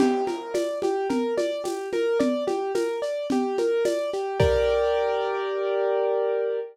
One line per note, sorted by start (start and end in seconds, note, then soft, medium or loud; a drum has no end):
0.00 0.24 G4 loud
0.00 crash loud
0.00 low conga loud
0.00 shaker medium
0.27 0.52 A#4 medium
0.27 high conga medium
0.27 shaker medium
0.54 0.79 D5 medium
0.54 tambourine medium
0.54 high conga loud
0.54 shaker medium
0.82 1.08 G4 medium
0.82 high conga medium
0.82 shaker medium
1.10 1.34 A#4 medium
1.10 low conga loud
1.10 shaker medium
1.38 1.62 D5 medium
1.38 high conga medium
1.38 shaker medium
1.64 1.89 G4 medium
1.64 tambourine loud
1.64 high conga medium
1.64 shaker medium
1.93 2.18 A#4 medium
1.93 high conga medium
1.93 shaker medium
2.19 2.44 D5 medium
2.19 low conga loud
2.19 shaker medium
2.47 2.72 G4 medium
2.47 high conga medium
2.47 shaker medium
2.75 3.00 A#4 medium
2.75 tambourine medium
2.75 high conga medium
2.75 shaker medium
3.02 3.27 D5 medium
3.02 shaker medium
3.30 3.57 G4 medium
3.30 low conga loud
3.30 shaker medium
3.58 3.84 A#4 medium
3.58 high conga medium
3.58 shaker medium
3.85 4.10 D5 medium
3.85 tambourine medium
3.85 high conga medium
3.85 shaker loud
4.13 4.38 G4 medium
4.13 shaker medium
4.40 6.60 G4 loud
4.40 6.60 A#4 loud
4.40 6.60 D5 loud
4.40 kick loud
4.40 crash loud